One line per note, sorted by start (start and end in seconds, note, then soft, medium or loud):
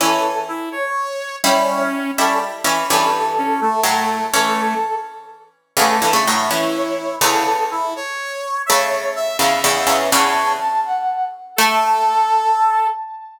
0.00 1.31 E3 medium
0.00 1.31 C#4 medium
0.00 0.22 E4 loud
0.00 0.40 A4 medium
0.48 0.69 E4 medium
0.72 1.36 C#5 medium
0.72 0.92 C#5 medium
1.43 1.89 G3 medium
1.43 2.11 C#4 loud
1.43 1.89 E4 medium
1.43 1.83 C#5 medium
2.17 2.64 G3 medium
2.17 2.39 C#4 loud
2.17 2.64 E4 medium
2.17 2.38 A4 medium
2.64 2.84 E3 medium
2.64 2.84 C#4 medium
2.89 3.75 G2 medium
2.89 3.75 E3 medium
2.89 3.10 C#4 loud
2.89 3.80 A4 medium
3.38 3.60 C#4 medium
3.61 4.25 A3 medium
3.83 4.28 A2 medium
3.83 4.28 F#3 medium
3.83 4.26 A4 medium
4.34 4.80 E3 medium
4.34 4.74 A3 medium
4.34 4.80 C#4 medium
4.34 4.95 A4 medium
5.77 5.97 E2 medium
5.77 5.97 C#3 medium
5.77 6.01 A3 loud
5.77 6.17 A4 medium
6.02 6.13 G2 medium
6.02 6.13 E3 medium
6.13 6.25 C#3 medium
6.13 6.25 A3 medium
6.27 6.50 A2 medium
6.27 6.50 F#3 medium
6.27 6.50 A3 medium
6.50 7.21 E3 medium
6.50 7.21 C#4 medium
6.50 7.16 E4 medium
6.75 7.16 C#5 medium
7.21 8.00 E2 medium
7.21 8.00 C#3 medium
7.21 7.44 E4 loud
7.21 7.64 A4 medium
7.71 7.94 E4 medium
7.96 8.62 C#5 medium
8.66 9.39 C#3 medium
8.66 9.40 A3 medium
8.66 9.13 C#5 medium
8.66 8.86 E5 loud
9.16 9.37 E5 loud
9.39 9.61 E2 medium
9.39 9.61 C#3 medium
9.39 9.98 E5 loud
9.64 9.86 E2 medium
9.64 9.86 C#3 medium
9.64 10.10 E5 medium
9.87 10.09 E2 medium
9.87 10.09 C#3 medium
10.12 10.55 E2 medium
10.12 10.55 C#3 medium
10.12 10.52 C#5 loud
10.12 10.52 A5 medium
10.60 10.81 A5 medium
10.85 11.25 F#5 medium
11.56 12.89 A3 loud
11.56 12.87 A4 loud
11.56 12.88 A5 loud